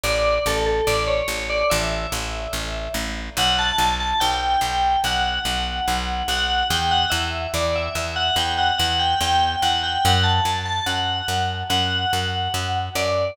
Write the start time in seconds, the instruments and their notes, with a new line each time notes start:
0.04 electric bass (finger) A1, tubular bells D5
0.46 electric bass (finger) A1, tubular bells A4
0.66 tubular bells A4
0.87 electric bass (finger) A1, tubular bells D5
1.07 tubular bells C#5
1.28 electric bass (finger) A1
1.50 tubular bells D5
1.70 electric bass (finger) A1, tubular bells E5
2.12 electric bass (finger) A1
2.53 electric bass (finger) A1
2.94 electric bass (finger) A1
3.37 electric bass (finger) B1, tubular bells F#5
3.59 tubular bells A5
3.78 electric bass (finger) B1
4.00 tubular bells A5
4.20 electric bass (finger) B1, tubular bells G5
4.61 electric bass (finger) B1
5.04 electric bass (finger) B1, tubular bells F#5
5.45 electric bass (finger) B1
5.88 electric bass (finger) B1
6.28 electric bass (finger) B1, tubular bells F#5
6.70 electric bass (finger) E2, tubular bells G5
6.91 tubular bells F#5
7.10 electric bass (finger) E2, tubular bells E5
7.54 electric bass (finger) E2, tubular bells D5
7.76 tubular bells E5
7.95 electric bass (finger) E2, tubular bells E5
8.16 tubular bells F#5
8.36 electric bass (finger) E2, tubular bells G5
8.58 tubular bells F#5
8.78 electric bass (finger) E2, tubular bells F#5
8.99 tubular bells G5
9.21 electric bass (finger) E2, tubular bells G5
9.62 electric bass (finger) E2, tubular bells F#5
9.83 tubular bells G5
10.05 electric bass (finger) F#2, tubular bells F#5
10.24 tubular bells A5
10.45 electric bass (finger) F#2
10.66 tubular bells A5
10.86 electric bass (finger) F#2, tubular bells F#5
11.28 electric bass (finger) F#2
11.70 electric bass (finger) F#2, tubular bells F#5
12.13 electric bass (finger) F#2
12.54 electric bass (finger) F#2
12.95 electric bass (finger) F#2, tubular bells D5